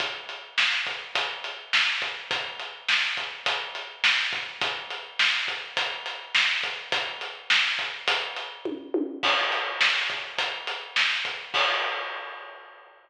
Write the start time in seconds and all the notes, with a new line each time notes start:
0.00 kick, closed hi-hat
0.29 closed hi-hat
0.58 snare
0.87 kick, closed hi-hat
1.15 kick, closed hi-hat
1.44 closed hi-hat
1.73 snare
2.02 kick, closed hi-hat
2.31 kick, closed hi-hat
2.59 closed hi-hat
2.88 snare
3.17 kick, closed hi-hat
3.46 kick, closed hi-hat
3.75 closed hi-hat
4.04 snare
4.33 kick, closed hi-hat
4.61 kick, closed hi-hat
4.91 closed hi-hat
5.19 snare
5.48 kick, closed hi-hat
5.77 kick, closed hi-hat
6.06 closed hi-hat
6.35 snare
6.63 kick, closed hi-hat
6.92 kick, closed hi-hat
7.21 closed hi-hat
7.50 snare
7.79 kick, closed hi-hat
8.08 kick, closed hi-hat
8.36 closed hi-hat
8.65 kick, high tom
8.94 high tom
9.23 kick, crash
9.52 closed hi-hat
9.81 snare
10.10 kick, closed hi-hat
10.38 kick, closed hi-hat
10.67 closed hi-hat
10.96 snare
11.25 kick, closed hi-hat
11.54 kick, crash